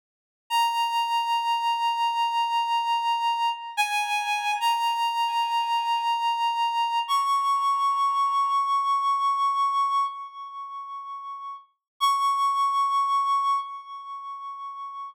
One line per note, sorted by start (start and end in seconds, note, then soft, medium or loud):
0.50 3.50 A#5 medium
3.77 4.52 G#5 medium
4.60 6.99 A#5 medium
7.08 10.04 C#6 medium
12.00 13.58 C#6 medium